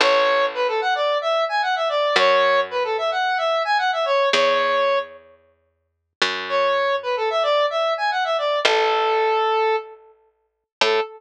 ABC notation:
X:1
M:4/4
L:1/16
Q:1/4=111
K:A
V:1 name="Lead 1 (square)"
c4 B A f d2 e2 g f e d2 | c4 B A e f2 e2 g f e c2 | c6 z10 | c4 B A e d2 e2 g f e d2 |
A10 z6 | A4 z12 |]
V:2 name="Electric Bass (finger)" clef=bass
A,,,16 | F,,16 | E,,14 F,,2- | F,,16 |
A,,,16 | A,,4 z12 |]